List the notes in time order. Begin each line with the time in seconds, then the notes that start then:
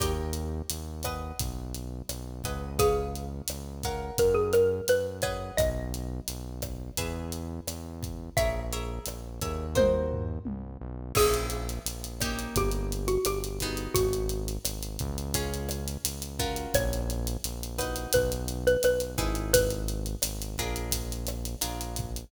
0.00 D#2 G4 A#4 C#5 D#5 G5, kick, cross-stick, closed hi-hat
0.33 closed hi-hat
0.70 D#2, closed hi-hat
1.03 B4 D#5 F#5 G#5, kick, cross-stick, closed hi-hat
1.39 B1, kick, closed hi-hat
1.74 closed hi-hat
2.09 B1, cross-stick, closed hi-hat
2.44 C#2 B4 D#5 F#5 G#5, kick, closed hi-hat
2.79 G#4 B4 C#5 F5 G#5, kick, closed hi-hat
3.16 closed hi-hat
3.48 C#2, cross-stick, closed hi-hat
3.83 A#4 C#5 F5 F#5, kick, closed hi-hat
4.18 F#2 A#4, kick, closed hi-hat
4.34 G#4
4.53 A#4, cross-stick, closed hi-hat
4.88 F#2 B4, closed hi-hat
5.22 G#4 B4 C#5 D#5 F#5, kick, closed hi-hat
5.57 B1 D#5, kick, cross-stick, closed hi-hat
5.94 closed hi-hat
6.28 B1, closed hi-hat
6.62 kick, cross-stick, closed hi-hat
6.97 E2 G#4 B4 E5, kick, closed hi-hat
7.32 closed hi-hat
7.67 E2, cross-stick, closed hi-hat
8.03 kick, closed hi-hat
8.37 A#1 G#4 A#4 C#5 E5, kick, closed hi-hat
8.73 G#4 A#4 C#5 E5, closed hi-hat
9.06 A#1, cross-stick, closed hi-hat
9.41 D#2 G#4 A#4 C#5 E5, kick, closed hi-hat
9.75 F#4 A#4 C5 D#5, kick, high tom
10.12 floor tom
10.45 C2, high tom
10.81 B1
11.15 A#1 A#3 C#4 E4 G#4, kick, cross-stick, crash
11.34 closed hi-hat
11.50 closed hi-hat
11.69 closed hi-hat
11.86 A#1, closed hi-hat
12.04 closed hi-hat
12.20 A#3 C#4 D#4 G4, kick, cross-stick, closed hi-hat
12.39 closed hi-hat
12.56 G1 G4, kick, closed hi-hat
12.72 closed hi-hat
12.92 closed hi-hat
13.08 F#4, closed hi-hat
13.25 G1 G4, cross-stick, closed hi-hat
13.44 closed hi-hat
13.60 B3 D#4 F#4 G#4, kick, closed hi-hat
13.77 closed hi-hat
13.94 G#1 F#4, kick, closed hi-hat
14.13 closed hi-hat
14.29 closed hi-hat
14.48 closed hi-hat
14.65 G#1, cross-stick, closed hi-hat
14.83 closed hi-hat
14.99 C#2, kick, closed hi-hat
15.18 closed hi-hat
15.34 C#4 F4 G#4, kick, closed hi-hat
15.54 closed hi-hat
15.69 cross-stick, closed hi-hat
15.88 closed hi-hat
16.05 C#2, closed hi-hat
16.22 closed hi-hat
16.39 C#4 F4 F#4 A#4, kick, closed hi-hat
16.56 closed hi-hat
16.74 A#1 C#5, kick, cross-stick, closed hi-hat
16.93 closed hi-hat
17.10 closed hi-hat
17.27 closed hi-hat
17.44 A#1, closed hi-hat
17.63 closed hi-hat
17.78 D#4 F#4 B4, kick, cross-stick, closed hi-hat
17.96 closed hi-hat
18.13 B1 B4, kick, closed hi-hat
18.32 closed hi-hat
18.48 closed hi-hat
18.67 B4, closed hi-hat
18.83 B1 B4, cross-stick, closed hi-hat
19.00 closed hi-hat
19.18 G#1 D#4 E4 G#4 B4, kick, closed hi-hat
19.35 closed hi-hat
19.53 B4, kick, closed hi-hat
19.70 closed hi-hat
19.88 closed hi-hat
20.06 closed hi-hat
20.22 G#1, cross-stick, closed hi-hat
20.42 closed hi-hat
20.58 A#1 D4 F4 G#4 A#4, kick, closed hi-hat
20.76 closed hi-hat
20.91 kick, closed hi-hat
21.12 closed hi-hat
21.27 cross-stick, closed hi-hat
21.45 closed hi-hat
21.61 A#1 D4 F4 G#4 A#4, closed hi-hat
21.81 closed hi-hat
21.96 kick, closed hi-hat
22.16 closed hi-hat